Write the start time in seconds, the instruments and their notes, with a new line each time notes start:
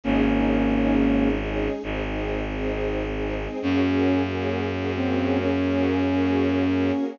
0.03 violin G#1, flute A#3 C#4, string ensemble 1 C#4 D#4 G#4, choir aahs C#4 D#4 G#4
0.26 string ensemble 1 C#4 D#4 G#4
0.71 string ensemble 1 C#4 D#4 G#4
0.93 choir aahs G#3 C#4 G#4
1.16 string ensemble 1 C#4 D#4 G#4
1.38 string ensemble 1 C#4 D#4 G#4
1.83 violin G#1, choir aahs C4 D#4 G#4, string ensemble 1 C4 D#4 G#4
2.05 string ensemble 1 C4 D#4 G#4
2.50 string ensemble 1 C4 D#4 G#4
2.72 choir aahs G#3 C4 G#4
3.16 string ensemble 1 C4 D#4 G#4
3.40 string ensemble 1 C4 D#4 G#4
3.62 violin F#2, string ensemble 1 A#3 C#4 F#4 G#4, choir aahs A#3 C#4 F#4 G#4, flute C#4
3.84 string ensemble 1 A#3 C#4 F#4 G#4
4.29 string ensemble 1 A#3 C#4 F#4 G#4
4.73 string ensemble 1 A#3 C#4 F#4 G#4
4.96 string ensemble 1 A#3 C#4 F#4 G#4, flute C4
5.41 choir aahs A#3 C#4 G#4 A#4, flute C#4
5.64 string ensemble 1 A#3 C#4 F#4 G#4
6.09 string ensemble 1 A#3 C#4 F#4 G#4
6.75 string ensemble 1 A#3 C#4 F#4 G#4
6.98 string ensemble 1 A#3 C#4 F#4 G#4